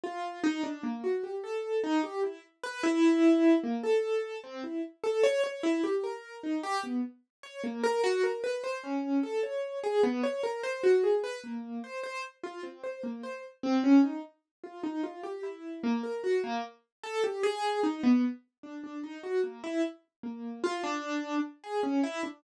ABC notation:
X:1
M:7/8
L:1/16
Q:1/4=75
K:none
V:1 name="Acoustic Grand Piano"
F2 _E D _B, _G =G A2 E G =E z =B | E4 _B, A3 C E z A _d d | E G _B2 _E G =B, z2 _d _B, B _G B | B c _D2 A _d2 _A B, d _B c _G A |
B _B,2 c c z F C c B, c z C _D | _E z2 F E F G =E2 _B, _B _G B, z | z A G _A2 _E B, z2 D D E _G _B, | E z2 _B,2 F D3 z _A _D E =D |]